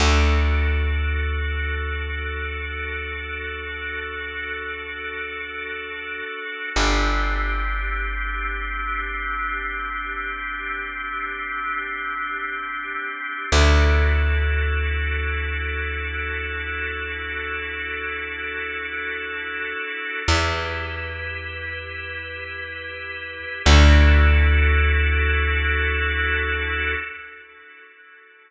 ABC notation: X:1
M:4/4
L:1/8
Q:1/4=71
K:Dmix
V:1 name="Drawbar Organ"
[DFA]8- | [DFA]8 | [CDG]8- | [CDG]8 |
[DEFA]8- | [DEFA]8 | [EGB]8 | [DEFA]8 |]
V:2 name="Electric Bass (finger)" clef=bass
D,,8- | D,,8 | G,,,8- | G,,,8 |
D,,8- | D,,8 | E,,8 | D,,8 |]